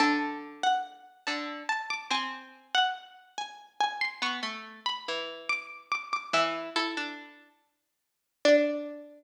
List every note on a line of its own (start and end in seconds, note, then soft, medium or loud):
0.00 1.06 D3 loud
0.00 0.60 A5 medium
0.63 1.21 F#5 medium
1.27 1.63 D3 medium
1.27 1.65 A5 medium
1.69 1.88 A5 medium
1.90 2.10 D6 medium
2.10 2.68 C4 loud
2.10 2.65 G#5 medium
2.75 3.31 F#5 medium
3.38 3.75 G#5 medium
3.80 4.00 G#5 medium
4.01 4.20 C6 medium
4.22 4.40 B3 loud
4.22 4.83 C#6 medium
4.43 4.80 A3 loud
4.86 5.45 B5 medium
5.08 5.89 E3 medium
5.49 5.86 D6 medium
5.92 6.09 D6 medium
6.13 6.32 D6 medium
6.33 6.70 E3 loud
6.33 6.73 E5 medium
6.76 6.95 E4 loud
6.76 8.16 A4 medium
6.97 7.49 D4 loud
8.45 9.24 D4 loud
8.45 9.24 D5 loud